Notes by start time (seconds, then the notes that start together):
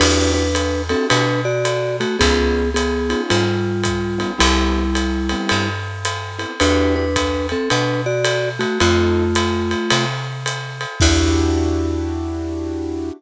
0.00 E2 D4 E4 F#4 G4 B4, crash, ride
0.34 D4 B4
0.55 hi-hat pedal, ride
0.89 C4 D4 E4 F#4 G4 A4, ride
1.10 B2 D4 B4, ride
1.45 F#4 D5
1.65 hi-hat pedal, ride
2.00 A3 F#4, ride
2.19 C#2 B3 C#4 D#4 F4 G#4, kick, ride
2.74 B3 G#4, hi-hat pedal, ride
3.09 B3 C#4 D#4 F4, ride
3.30 G#2 G3 F4, ride
3.83 kick, hi-hat pedal, ride
4.18 B3 C#4 D#4 F4, ride
4.38 C2 G3 B3 C4 E4 G4, ride
4.95 hi-hat pedal, ride
5.29 B3 C4 E4 G4, ride
5.49 G2, ride
6.05 hi-hat pedal, ride
6.39 B3 C4 E4 G4, ride
6.60 E2 D4 E4 F#4 G4 B4, ride
6.96 D4 B4
7.16 kick, hi-hat pedal, ride
7.49 C4 A4, ride
7.70 B2 D4 B4, ride
8.06 F#4 D5
8.25 hi-hat pedal, ride
8.59 A3 F#4, ride
8.80 F2 A3 C4 D#4 F4 A4, ride
9.35 hi-hat pedal, ride
9.71 ride
9.90 C3, ride
10.46 hi-hat pedal, ride
10.81 ride
11.00 E2 D4 E4 F#4 G4, kick, crash